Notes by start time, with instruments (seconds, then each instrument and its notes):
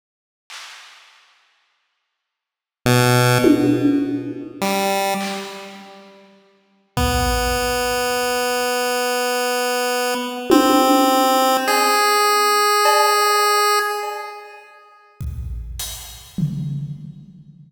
0.50 clap
2.86 lead 1 (square) B2
3.44 high tom
4.61 lead 1 (square) G3, clap
5.21 clap
6.97 lead 1 (square) B3, kick
10.50 lead 1 (square) C4, high tom
11.68 lead 1 (square) G#4, cowbell
12.85 cowbell
14.03 cowbell
15.21 kick
15.79 closed hi-hat
16.38 floor tom